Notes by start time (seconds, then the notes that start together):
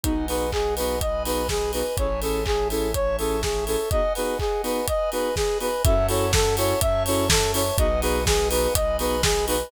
0.04 B1 B3 D#4 F#4 G#4 B4 D#5 F#5 G#5, kick, closed hi-hat
0.28 B3 D#4 F#4 G#4 B4, open hi-hat
0.52 G#4, kick, clap
0.77 B3 D#4 F#4 G#4 B4, open hi-hat
1.01 B4 D#5 G#5 B5, kick, closed hi-hat
1.25 B3 D#4 F#4 G#4 B4, open hi-hat
1.49 G#4, kick, snare
1.73 B3 D#4 F#4 G#4 B4, open hi-hat
1.97 A1 C#4 E4 G#4 A4 C#5 E5 G#5 A5, kick, closed hi-hat
2.22 C#4 E4 G#4 A4, open hi-hat
2.46 G#4, kick, clap
2.70 C#4 E4 G#4 A4, open hi-hat
2.94 C#5 E5 A5 C#6, kick, closed hi-hat
3.19 C#4 E4 G#4 A4, open hi-hat
3.43 G#4, kick, snare
3.67 C#4 E4 G#4 A4, open hi-hat
3.91 B3 D#4 F#4 G#4 B4 D#5 F#5 G#5, kick, closed hi-hat
4.15 B3 D#4 F#4 G#4 B4, open hi-hat
4.39 G#4, kick, clap
4.63 B3 D#4 F#4 G#4 B4, open hi-hat
4.88 B4 D#5 G#5 B5, kick, closed hi-hat
5.12 B3 D#4 F#4 G#4 B4, open hi-hat
5.36 G#4, kick, snare
5.60 B3 D#4 F#4 G#4 B4, open hi-hat
5.84 F#2 C#4 E4 F#4 A4 C#5 E5 F#5 A5, kick, closed hi-hat
6.09 C#4 E4 F#4 A4 C#5, open hi-hat
6.33 A4, kick, snare
6.57 C#4 E4 F#4 A4 C#5, open hi-hat
6.81 F#2 C#5 E5 A5 C#6, kick, closed hi-hat
7.06 C#4 E4 F#4 A4 C#5, open hi-hat
7.30 A4, kick, snare
7.54 C#4 E4 F#4 A4 C#5, open hi-hat
7.78 B1 B3 D#4 F#4 G#4 B4 D#5 F#5 G#5, kick, closed hi-hat
8.02 B3 D#4 F#4 G#4 B4, open hi-hat
8.26 G#4, kick, snare
8.51 B3 D#4 F#4 G#4 B4, open hi-hat
8.74 B1 B4 D#5 G#5 B5, kick, closed hi-hat
8.99 B3 D#4 F#4 G#4 B4, open hi-hat
9.23 G#4, kick, snare
9.47 B3 D#4 F#4 G#4 B4, open hi-hat